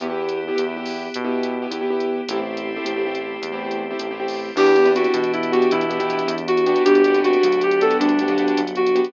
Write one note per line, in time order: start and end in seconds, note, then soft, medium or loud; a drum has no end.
0.00 0.51 E2 medium
0.00 0.07 B3 medium
0.00 2.26 B3 medium
0.00 0.07 E4 medium
0.00 2.26 E4 medium
0.00 0.07 G4 loud
0.00 2.26 G4 medium
0.00 closed hi-hat medium
0.10 0.40 B3 medium
0.10 0.40 E4 medium
0.10 0.40 G4 medium
0.29 closed hi-hat medium
0.48 0.55 B3 medium
0.48 0.55 E4 medium
0.48 0.55 G4 medium
0.56 1.10 E2 medium
0.56 0.63 B3 medium
0.56 0.63 E4 medium
0.56 0.63 G4 medium
0.56 closed hi-hat medium
0.66 0.74 B3 medium
0.66 0.74 E4 medium
0.66 0.74 G4 medium
0.77 1.07 B3 medium
0.77 1.07 E4 medium
0.77 1.07 G4 medium
0.86 open hi-hat medium
1.14 1.67 B2 medium
1.14 closed hi-hat medium
1.24 1.55 B3 medium
1.24 1.55 E4 medium
1.24 1.55 G4 medium
1.43 closed hi-hat medium
1.62 1.70 B3 medium
1.62 1.70 E4 medium
1.62 1.70 G4 medium
1.70 2.21 E2 medium
1.70 1.79 B3 medium
1.70 1.79 E4 medium
1.70 1.79 G4 medium
1.70 closed hi-hat medium
1.81 1.89 B3 medium
1.81 1.89 E4 medium
1.81 1.89 G4 medium
1.90 2.21 B3 medium
1.90 2.21 E4 medium
1.90 2.21 G4 medium
2.00 closed hi-hat medium
2.28 2.79 A1 medium
2.28 4.55 A3 medium
2.28 2.38 A3 medium
2.28 4.55 C4 medium
2.28 2.38 C4 medium
2.28 4.55 E4 medium
2.28 2.38 E4 loud
2.28 4.55 G4 medium
2.28 2.38 G4 loud
2.28 closed hi-hat loud
2.39 2.70 A3 medium
2.39 2.70 C4 medium
2.39 2.70 E4 medium
2.39 2.70 G4 medium
2.57 closed hi-hat medium
2.77 2.84 A3 medium
2.77 2.84 C4 medium
2.77 2.84 E4 medium
2.77 2.84 G4 medium
2.84 3.38 A1 medium
2.84 2.92 A3 medium
2.84 2.92 C4 medium
2.84 2.92 E4 medium
2.84 2.92 G4 medium
2.84 closed hi-hat medium
2.96 3.04 A3 medium
2.96 3.04 C4 medium
2.96 3.04 E4 medium
2.96 3.04 G4 medium
3.06 3.37 A3 medium
3.06 3.37 C4 medium
3.06 3.37 E4 medium
3.06 3.37 G4 medium
3.15 closed hi-hat medium
3.42 3.93 E2 medium
3.42 closed hi-hat medium
3.52 3.83 A3 medium
3.52 3.83 C4 medium
3.52 3.83 E4 medium
3.52 3.83 G4 medium
3.71 closed hi-hat medium
3.91 3.98 A3 medium
3.91 3.98 C4 medium
3.91 3.98 E4 medium
3.91 3.98 G4 medium
3.99 4.52 A1 medium
3.99 4.07 A3 medium
3.99 4.07 C4 medium
3.99 4.07 E4 medium
3.99 4.07 G4 medium
3.99 closed hi-hat medium
4.11 4.18 A3 medium
4.11 4.18 C4 medium
4.11 4.18 E4 medium
4.11 4.18 G4 medium
4.20 4.50 A3 medium
4.20 4.50 C4 medium
4.20 4.50 E4 medium
4.20 4.50 G4 medium
4.28 open hi-hat medium
4.56 5.07 E2 loud
4.56 4.72 B3 medium
4.56 6.84 B3 medium
4.56 4.72 D4 loud
4.56 4.85 D4 medium
4.56 6.84 D4 medium
4.56 4.72 E4 loud
4.56 6.84 E4 medium
4.56 4.72 G4 loud
4.56 4.90 G4 medium
4.56 6.84 G4 medium
4.56 crash medium
4.66 closed hi-hat medium
4.76 4.84 B3 medium
4.76 4.84 D4 medium
4.76 4.84 E4 medium
4.76 4.84 G4 medium
4.76 closed hi-hat medium
4.85 5.15 B3 medium
4.85 4.95 C4 loud
4.85 5.15 D4 medium
4.85 5.15 E4 medium
4.85 5.15 G4 medium
4.85 closed hi-hat medium
4.95 5.11 C4 medium
4.95 5.31 F#4 medium
4.95 closed hi-hat medium
5.04 closed hi-hat medium
5.14 5.65 B2 medium
5.14 5.69 E3 medium
5.14 closed hi-hat medium
5.23 closed hi-hat medium
5.33 5.52 E4 medium
5.33 closed hi-hat medium
5.43 closed hi-hat medium
5.52 5.83 B3 medium
5.52 5.83 D4 medium
5.52 5.83 E4 medium
5.52 5.70 F#4 medium
5.52 5.83 G4 medium
5.52 closed hi-hat medium
5.62 closed hi-hat medium
5.71 6.23 B2 medium
5.71 5.99 E3 loud
5.71 6.34 E4 medium
5.71 closed hi-hat medium
5.81 closed hi-hat medium
5.90 5.97 B3 medium
5.90 5.97 D4 medium
5.90 5.97 E4 medium
5.90 5.97 G4 medium
5.90 closed hi-hat medium
6.00 6.09 E3 medium
6.00 6.30 B3 medium
6.00 6.30 D4 medium
6.00 6.30 E4 medium
6.00 6.30 G4 loud
6.00 closed hi-hat medium
6.10 6.26 E3 medium
6.10 closed hi-hat medium
6.19 closed hi-hat medium
6.27 6.79 E2 medium
6.27 6.74 E3 medium
6.27 closed hi-hat medium
6.38 closed hi-hat medium
6.48 6.83 F#4 medium
6.48 closed hi-hat medium
6.57 closed hi-hat medium
6.66 7.01 B3 medium
6.66 7.01 D4 medium
6.66 7.01 F#4 loud
6.66 7.01 G4 medium
6.66 closed hi-hat medium
6.76 closed hi-hat medium
6.85 7.37 G1 loud
6.85 9.12 B3 medium
6.85 9.12 D4 medium
6.85 7.13 D4 loud
6.85 9.12 F#4 medium
6.85 7.19 G4 medium
6.85 9.12 G4 medium
6.85 closed hi-hat loud
6.95 closed hi-hat medium
7.04 7.12 B3 medium
7.04 7.12 D4 medium
7.04 7.12 F#4 medium
7.04 7.12 G4 medium
7.04 closed hi-hat medium
7.14 7.45 B3 medium
7.14 7.23 C4 medium
7.14 7.45 D4 medium
7.14 7.45 F#4 medium
7.14 7.45 G4 medium
7.14 closed hi-hat medium
7.24 7.40 C4 medium
7.24 7.61 F#4 medium
7.24 closed hi-hat medium
7.33 closed hi-hat medium
7.43 7.95 D2 medium
7.43 7.98 F#3 medium
7.43 closed hi-hat medium
7.52 closed hi-hat medium
7.61 7.81 G4 medium
7.61 closed hi-hat medium
7.71 closed hi-hat medium
7.81 8.11 B3 medium
7.81 8.11 D4 medium
7.81 8.11 F#4 medium
7.81 8.11 G4 medium
7.81 7.97 A4 medium
7.81 closed hi-hat medium
7.91 closed hi-hat medium
8.00 8.51 D2 medium
8.00 8.24 G3 loud
8.00 8.61 D4 medium
8.00 closed hi-hat medium
8.09 closed hi-hat medium
8.19 8.28 B3 medium
8.19 8.28 D4 medium
8.19 8.28 F#4 medium
8.19 8.28 G4 medium
8.19 closed hi-hat medium
8.28 8.37 F#3 loud
8.28 8.60 B3 medium
8.28 8.60 D4 medium
8.28 8.60 F#4 medium
8.28 8.60 G4 medium
8.28 closed hi-hat medium
8.38 8.54 F#3 medium
8.38 closed hi-hat medium
8.48 closed hi-hat medium
8.57 9.09 G1 medium
8.57 9.10 F#3 medium
8.57 closed hi-hat medium
8.67 closed hi-hat medium
8.75 9.07 F#4 medium
8.75 closed hi-hat medium
8.87 closed hi-hat medium
8.95 9.11 B3 medium
8.95 9.11 D4 medium
8.95 9.11 F#4 medium
8.95 9.11 G4 medium
8.95 closed hi-hat medium
9.04 closed hi-hat medium